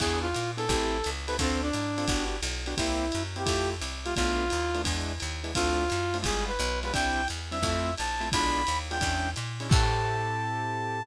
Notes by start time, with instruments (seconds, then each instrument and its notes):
0.00 electric bass (finger) E2, acoustic grand piano B3 D4 E4 G#4, brass section G#4, kick, crash, ride
0.22 brass section F4
0.34 electric bass (finger) A#2, hi-hat pedal, ride
0.57 acoustic grand piano B3 D4 E4 G#4, brass section A4, ride
0.69 electric bass (finger) A1, acoustic grand piano C4 E4 G4 A4, kick, ride
1.04 electric bass (finger) C#2, hi-hat pedal, ride
1.27 acoustic grand piano C4 E4 G4 A4, brass section B4, ride
1.39 electric bass (finger) D2, brass section C4, acoustic grand piano C4 D4 F4 A4, kick, ride
1.63 brass section D4
1.73 electric bass (finger) G#2, hi-hat pedal, ride
1.98 acoustic grand piano C4 D4 F4 A4, ride
2.08 electric bass (finger) G1, acoustic grand piano B3 D4 F#4 G4, kick, ride
2.42 electric bass (finger) B1, hi-hat pedal, ride
2.66 acoustic grand piano B3 D4 F#4 G4, ride
2.77 electric bass (finger) C2, acoustic grand piano A#3 C4 E4 G4, brass section E4, kick, ride
3.12 electric bass (finger) F#2, hi-hat pedal, ride
3.36 acoustic grand piano A#3 C4 E4 G4, brass section G4, ride
3.46 electric bass (finger) F2, acoustic grand piano A3 E4 F4 G4, kick, ride
3.82 electric bass (finger) C2, hi-hat pedal, ride
4.05 acoustic grand piano A3 E4 F4 G4, brass section F4, ride
4.16 electric bass (finger) B1, acoustic grand piano A3 B3 D4 F4, brass section F4, kick, ride
4.50 electric bass (finger) D#2, hi-hat pedal, ride
4.74 acoustic grand piano A3 B3 D4 F4, ride
4.84 electric bass (finger) E2, acoustic grand piano G#3 B3 D4 E4, kick, ride
5.20 electric bass (finger) D#2, hi-hat pedal, ride
5.44 acoustic grand piano G#3 B3 D4 E4, ride
5.55 electric bass (finger) D2, acoustic grand piano A3 C4 D4 F4, brass section F4, kick, ride
5.90 electric bass (finger) F#2, hi-hat pedal, ride
6.14 acoustic grand piano A3 C4 D4 F4, ride
6.23 electric bass (finger) G1, acoustic grand piano G3 G#3 B3 F4, brass section G#4, kick, ride
6.48 brass section B4
6.59 electric bass (finger) B1, hi-hat pedal, ride
6.83 acoustic grand piano G3 G#3 B3 F4, brass section B4, ride
6.93 electric bass (finger) C2, acoustic grand piano G3 C4 D4 E4, brass section G5, kick, ride
7.28 electric bass (finger) E2, hi-hat pedal, ride
7.51 acoustic grand piano G3 C4 D4 E4, brass section E5, ride
7.62 electric bass (finger) F2, acoustic grand piano A3 C4 E4 F4, kick, ride
7.97 electric bass (finger) A#1, brass section A5, hi-hat pedal, ride
8.20 acoustic grand piano A3 C4 E4 F4, ride
8.32 electric bass (finger) B1, acoustic grand piano G#3 B3 D4 F4, brass section B5, kick, ride
8.67 electric bass (finger) D#2, hi-hat pedal, ride
8.91 acoustic grand piano G#3 B3 D4 F4, brass section G5, ride
9.01 electric bass (finger) E2, acoustic grand piano G#3 C#4 D4 E4, kick, ride
9.36 electric bass (finger) A#2, hi-hat pedal, ride
9.60 acoustic grand piano G#3 C#4 D4 E4, ride
9.69 electric bass (finger) A2, acoustic grand piano C4 E4 G4 A4, brass section A5, kick, crash